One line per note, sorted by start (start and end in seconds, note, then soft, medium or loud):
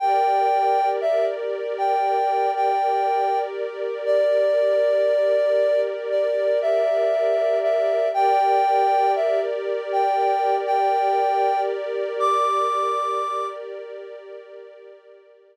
0.00 8.06 G4 medium
0.00 8.06 A#4 medium
0.00 8.06 D5 medium
0.00 0.89 G5 loud
1.01 1.25 E5 loud
1.78 2.51 G5 loud
2.56 3.39 G5 loud
4.06 5.81 D5 loud
6.10 6.59 D5 medium
6.62 7.59 E5 loud
7.63 8.09 E5 loud
8.14 15.57 G4 medium
8.14 15.57 A#4 medium
8.14 15.57 D5 medium
8.14 9.12 G5 loud
9.16 9.40 E5 medium
9.92 10.56 G5 loud
10.67 11.61 G5 loud
12.19 13.46 D6 loud